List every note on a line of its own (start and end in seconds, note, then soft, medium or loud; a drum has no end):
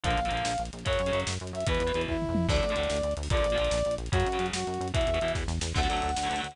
0.03 0.16 A#1 loud
0.03 0.20 D3 loud
0.03 0.20 F3 loud
0.03 0.20 A#3 loud
0.03 0.62 F5 loud
0.03 kick loud
0.03 closed hi-hat loud
0.10 closed hi-hat medium
0.17 0.29 A#1 medium
0.17 closed hi-hat medium
0.25 0.31 D3 medium
0.25 0.31 F3 medium
0.25 0.32 A#3 medium
0.25 closed hi-hat medium
0.31 0.43 A#1 medium
0.31 0.53 D3 medium
0.31 0.53 F3 medium
0.31 closed hi-hat medium
0.35 0.53 A#3 medium
0.35 closed hi-hat medium
0.45 0.57 A#1 medium
0.45 snare loud
0.51 closed hi-hat medium
0.58 0.70 A#1 medium
0.58 closed hi-hat loud
0.65 closed hi-hat medium
0.73 0.84 A#1 medium
0.73 closed hi-hat medium
0.79 closed hi-hat medium
0.85 0.98 F#2 medium
0.85 1.01 C#3 medium
0.85 1.01 F#3 loud
0.85 1.20 C#5 loud
0.85 kick loud
0.85 closed hi-hat loud
0.93 closed hi-hat medium
0.99 1.11 F#2 medium
0.99 closed hi-hat medium
1.06 1.12 C#3 medium
1.06 1.12 F#3 medium
1.06 closed hi-hat medium
1.12 1.24 F#2 medium
1.12 1.34 C#3 medium
1.12 1.34 F#3 medium
1.12 closed hi-hat medium
1.20 closed hi-hat medium
1.27 1.38 F#2 medium
1.27 snare loud
1.33 closed hi-hat medium
1.40 1.52 F#2 medium
1.40 closed hi-hat medium
1.47 closed hi-hat medium
1.53 1.64 F#2 medium
1.53 1.66 E5 medium
1.53 closed hi-hat medium
1.60 closed hi-hat medium
1.66 1.79 E2 medium
1.66 1.83 B2 loud
1.66 1.83 E3 medium
1.66 2.01 B4 loud
1.66 kick loud
1.66 closed hi-hat loud
1.74 closed hi-hat medium
1.80 1.92 E2 medium
1.80 closed hi-hat loud
1.87 1.92 B2 medium
1.87 1.92 E3 medium
1.87 closed hi-hat medium
1.94 2.06 E2 medium
1.94 2.17 B2 medium
1.94 2.17 E3 medium
1.94 closed hi-hat medium
2.01 closed hi-hat medium
2.08 2.27 E2 medium
2.08 2.47 E4 medium
2.08 kick loud
2.08 floor tom loud
2.22 mid tom loud
2.29 2.47 F2 medium
2.35 high tom loud
2.49 2.61 D2 medium
2.49 2.65 A2 loud
2.49 2.65 D3 medium
2.49 3.13 D5 loud
2.49 kick loud
2.49 crash loud
2.56 closed hi-hat medium
2.63 2.75 D2 medium
2.63 closed hi-hat medium
2.69 2.75 A2 medium
2.69 2.75 D3 medium
2.69 closed hi-hat medium
2.76 2.88 D2 medium
2.76 2.98 A2 medium
2.76 2.98 D3 medium
2.76 closed hi-hat loud
2.83 closed hi-hat medium
2.90 3.02 D2 medium
2.90 snare loud
2.96 closed hi-hat medium
3.03 3.14 D2 medium
3.03 closed hi-hat medium
3.11 closed hi-hat medium
3.17 3.28 D2 medium
3.17 closed hi-hat loud
3.23 open hi-hat medium
3.30 3.42 A#1 medium
3.30 3.47 A#2 medium
3.30 3.47 D3 loud
3.30 3.47 F3 loud
3.30 3.95 D5 loud
3.30 kick loud
3.30 closed hi-hat loud
3.37 closed hi-hat medium
3.44 3.56 A#1 medium
3.44 closed hi-hat loud
3.50 3.57 A#2 medium
3.50 3.57 D3 medium
3.50 closed hi-hat medium
3.56 3.69 A#1 medium
3.56 3.79 A#2 medium
3.56 3.79 D3 medium
3.56 3.59 F3 medium
3.56 closed hi-hat medium
3.61 3.79 F3 medium
3.61 closed hi-hat medium
3.71 3.83 A#1 medium
3.71 snare loud
3.78 closed hi-hat medium
3.85 3.97 A#1 medium
3.85 closed hi-hat medium
3.91 closed hi-hat medium
3.98 4.10 A#1 medium
3.98 closed hi-hat medium
4.06 closed hi-hat medium
4.12 4.24 F#2 loud
4.12 4.28 C#3 loud
4.12 4.28 F#3 medium
4.12 4.46 F#4 loud
4.12 kick loud
4.12 closed hi-hat loud
4.20 closed hi-hat loud
4.26 4.38 F#2 medium
4.26 closed hi-hat medium
4.32 4.38 C#3 medium
4.32 4.38 F#3 medium
4.32 closed hi-hat medium
4.38 4.51 F#2 medium
4.38 4.60 C#3 medium
4.38 4.60 F#3 medium
4.38 closed hi-hat loud
4.46 closed hi-hat medium
4.53 4.64 F#2 medium
4.53 4.88 F#4 medium
4.53 snare loud
4.60 closed hi-hat medium
4.67 4.79 F#2 medium
4.67 closed hi-hat medium
4.74 closed hi-hat medium
4.80 4.92 F#2 medium
4.80 closed hi-hat medium
4.88 closed hi-hat medium
4.94 5.05 E2 medium
4.94 5.10 B2 loud
4.94 5.10 E3 medium
4.94 5.32 E5 loud
4.94 kick loud
4.94 closed hi-hat loud
5.01 closed hi-hat medium
5.07 5.19 E2 medium
5.07 closed hi-hat medium
5.14 5.19 B2 medium
5.14 5.19 E3 medium
5.14 closed hi-hat medium
5.21 5.33 E2 medium
5.21 5.44 B2 medium
5.21 5.44 E3 medium
5.21 closed hi-hat medium
5.28 closed hi-hat medium
5.35 5.47 E2 medium
5.35 kick loud
5.35 snare loud
5.48 5.59 E2 medium
5.48 snare loud
5.61 5.73 E2 medium
5.61 snare loud
5.74 5.88 D2 medium
5.74 5.80 D3 loud
5.74 5.80 F#3 loud
5.74 5.81 A3 loud
5.74 6.40 F#5 medium
5.74 kick loud
5.74 crash loud
5.82 5.87 D3 medium
5.82 5.87 F#3 medium
5.82 5.88 A3 medium
5.82 ride medium
5.89 6.01 D2 medium
5.89 6.11 D3 medium
5.89 6.11 F#3 medium
5.89 6.11 A3 medium
5.89 ride medium
5.97 ride medium
6.02 6.15 D2 medium
6.02 ride medium
6.09 ride medium
6.16 6.29 D2 medium
6.16 snare loud
6.23 6.29 D3 medium
6.23 6.29 F#3 medium
6.23 ride medium
6.27 6.41 D2 medium
6.27 6.35 D3 medium
6.27 6.30 A3 medium
6.27 ride medium
6.31 6.35 F#3 medium
6.31 6.36 A3 medium
6.36 6.48 D3 medium
6.36 6.48 F#3 medium
6.36 ride medium
6.40 6.55 D2 medium
6.40 6.48 A3 medium
6.40 6.55 F#5 medium
6.44 ride medium
6.51 6.56 D3 medium
6.51 6.56 F#3 medium
6.51 ride medium